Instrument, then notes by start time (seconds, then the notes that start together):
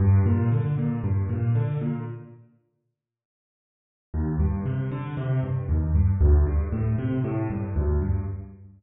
acoustic grand piano
0.00 G2
0.26 A#2
0.52 D3
0.78 A#2
1.03 G2
1.29 A#2
1.55 D3
1.81 A#2
4.14 D#2
4.40 G2
4.66 C3
4.91 D3
5.17 C3
5.43 G2
5.69 D#2
5.95 G2
6.21 D2
6.47 G2
6.72 A2
6.98 C3
7.24 A2
7.50 G2
7.76 D2
8.02 G2